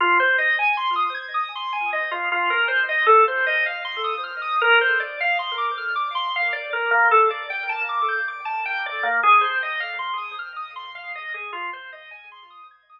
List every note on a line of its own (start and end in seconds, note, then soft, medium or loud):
0.00 0.18 F4 loud
0.20 0.37 C5 medium
0.38 0.56 D#5 medium
0.59 0.76 G#5 medium
0.77 0.94 C6 loud
0.96 1.13 D#6 medium
1.14 1.32 G#6 medium
1.34 1.51 D#6 medium
1.55 1.73 C6 medium
1.73 1.90 G#5 medium
1.93 2.10 D#5 medium
2.11 2.29 F4 medium
2.32 2.49 F4 loud
2.50 2.67 A#4 medium
2.68 2.85 C5 medium
2.89 3.06 D#5 medium
3.06 3.24 A4 loud
3.28 3.45 C5 medium
3.46 3.64 D#5 loud
3.66 3.83 F5 medium
3.85 4.02 C6 loud
4.04 4.21 D#6 medium
4.24 4.41 F6 medium
4.42 4.59 D#6 loud
4.61 4.79 A#4 loud
4.81 4.98 C5 medium
5.00 5.17 D5 medium
5.20 5.38 F5 loud
5.39 5.56 C6 medium
5.58 5.75 D6 medium
5.78 5.95 F6 medium
5.95 6.13 D6 medium
6.15 6.32 C6 loud
6.36 6.53 F5 medium
6.53 6.70 D5 medium
6.73 6.90 A#4 medium
6.91 7.08 A#3 loud
7.11 7.29 A4 medium
7.30 7.48 D5 medium
7.50 7.67 G5 medium
7.69 7.86 A5 medium
7.89 8.06 D6 loud
8.08 8.26 G6 medium
8.28 8.45 D6 medium
8.45 8.63 A5 loud
8.65 8.83 G5 loud
8.86 9.03 D5 loud
9.03 9.20 A#3 medium
9.23 9.41 G#4 loud
9.41 9.58 C5 medium
9.63 9.80 D#5 medium
9.80 9.97 F5 medium
9.99 10.16 C6 loud
10.18 10.35 D#6 medium
10.39 10.56 F6 medium
10.56 10.74 D#6 medium
10.76 10.93 C6 medium
10.95 11.12 F5 medium
11.15 11.33 D#5 loud
11.34 11.51 G#4 medium
11.53 11.70 F4 loud
11.73 11.91 C5 medium
11.92 12.10 D#5 medium
12.11 12.28 G#5 medium
12.32 12.49 C6 loud
12.50 12.68 D#6 medium
12.71 12.88 G#6 medium
12.89 13.00 D#6 loud